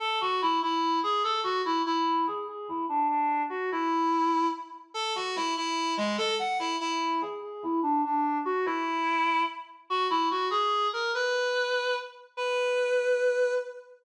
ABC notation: X:1
M:6/8
L:1/8
Q:3/8=97
K:A
V:1 name="Clarinet"
A F E E2 G | A F E E2 G | G E D D2 F | E4 z2 |
A F E E2 G, | A f E E2 G | G E D D2 F | E4 z2 |
[K:B] F E F G2 A | B4 z2 | B6 |]